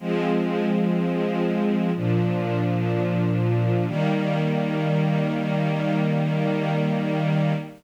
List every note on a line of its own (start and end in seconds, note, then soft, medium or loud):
0.00 1.91 F3 medium
0.00 1.91 G#3 medium
0.00 1.91 C4 medium
1.95 3.86 A#2 medium
1.95 3.86 F3 medium
1.95 3.86 D4 medium
3.87 7.53 D#3 loud
3.87 7.53 G3 loud
3.87 7.53 A#3 loud